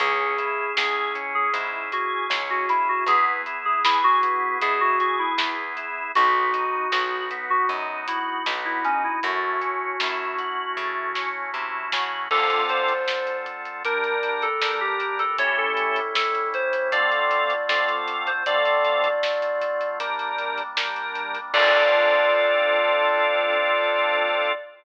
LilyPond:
<<
  \new Staff \with { instrumentName = "Electric Piano 2" } { \time 4/4 \key cis \minor \tempo 4 = 78 gis'4 gis'8 r16 gis'16 r8 fis'8 r16 fis'16 e'16 fis'16 | gis'16 r8 gis'16 e'16 fis'8. gis'16 fis'16 fis'16 e'8 r8. | fis'4 fis'8 r16 fis'16 r8 e'8 r16 e'16 cis'16 e'16 | fis'2. r4 |
\key d \minor a'8 c''4 r8 bes'8. a'8 g'8 a'16 | cis''16 a'8. a'8 c''8 d''4 d''16 r8 c''16 | d''2 r2 | d''1 | }
  \new Staff \with { instrumentName = "Drawbar Organ" } { \time 4/4 \key cis \minor cis'8 e'8 gis'8 cis'8 e'8 gis'8 cis'8 e'8 | b8 e'8 gis'8 b8 e'8 gis'8 b8 e'8 | b8 dis'8 fis'8 b8 dis'8 fis'8 b8 dis'8 | a8 cis'8 e'8 fis'8 a8 cis'8 e'8 fis'8 |
\key d \minor <d c' f' a'>2 <g d' bes'>4 <g d' bes'>4 | <a cis' e' g'>2 <d c' f' a'>4 <d c' f' a'>4 | <d c' f' a'>2 <g d' bes'>4 <g d' bes'>4 | <c' d' f' a'>1 | }
  \new Staff \with { instrumentName = "Electric Bass (finger)" } { \clef bass \time 4/4 \key cis \minor cis,4 cis,4 gis,4 cis,4 | e,4 e,4 b,4 e,4 | b,,4 b,,4 fis,4 b,,4 | fis,4 fis,4 cis4 bis,8 cis8 |
\key d \minor r1 | r1 | r1 | r1 | }
  \new Staff \with { instrumentName = "Drawbar Organ" } { \time 4/4 \key cis \minor <cis' e' gis'>1 | <b e' gis'>1 | <b dis' fis'>1 | <a cis' e' fis'>1 |
\key d \minor <d c' f' a'>2 <g d' bes'>2 | <a, g cis' e'>2 <d a c' f'>2 | <d a c' f'>2 <g bes d'>2 | <c' d' f' a'>1 | }
  \new DrumStaff \with { instrumentName = "Drums" } \drummode { \time 4/4 <hh bd>8 hh8 sn8 <hh bd>8 <hh bd>8 hh8 sn8 hh8 | <hh bd>8 hh8 sn8 <hh bd>8 <hh bd>8 hh8 sn8 hh8 | <hh bd>8 hh8 sn8 <hh bd>8 bd8 hh8 sn8 hh8 | <hh bd>8 hh8 sn8 hh8 bd8 sn8 r8 sn8 |
<cymc bd>16 hh16 hh16 hh16 sn16 hh16 <hh bd>16 hh16 <hh bd>16 hh16 hh16 hh16 sn8 hh16 hh16 | <hh bd>8 hh16 hh16 sn16 hh16 <hh bd>16 hh16 <hh bd>16 hh16 hh16 hh16 sn16 hh16 hh16 hh16 | <hh bd>16 hh16 hh16 hh16 sn16 hh16 <hh bd>16 hh16 <hh bd>16 hh16 hh16 hh16 sn16 hh16 hh16 hh16 | <cymc bd>4 r4 r4 r4 | }
>>